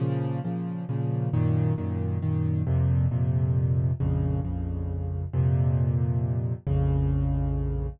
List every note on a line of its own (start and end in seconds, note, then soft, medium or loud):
0.00 0.40 A#2 medium
0.00 0.40 C#3 loud
0.00 0.40 F3 loud
0.44 0.84 A#2 medium
0.44 0.84 C#3 medium
0.44 0.84 F3 medium
0.89 1.29 A#2 medium
0.89 1.29 C#3 medium
0.89 1.29 F3 medium
1.33 1.73 F#2 loud
1.33 1.73 A#2 loud
1.33 1.73 D#3 loud
1.78 2.18 F#2 medium
1.78 2.18 A#2 medium
1.78 2.18 D#3 medium
2.22 2.62 F#2 medium
2.22 2.62 A#2 medium
2.22 2.62 D#3 loud
2.67 3.07 F2 loud
2.67 3.07 A#2 loud
2.67 3.07 C3 loud
3.11 3.91 F2 medium
3.11 3.91 A#2 medium
3.11 3.91 C3 medium
4.00 4.40 A#1 loud
4.00 4.40 F2 loud
4.00 4.40 C#3 loud
4.45 5.25 A#1 medium
4.45 5.25 F2 medium
4.45 5.25 C#3 medium
5.33 6.53 F2 loud
5.33 6.53 A#2 loud
5.33 6.53 C3 loud
6.67 7.87 A#1 loud
6.67 7.87 F2 medium
6.67 7.87 C#3 loud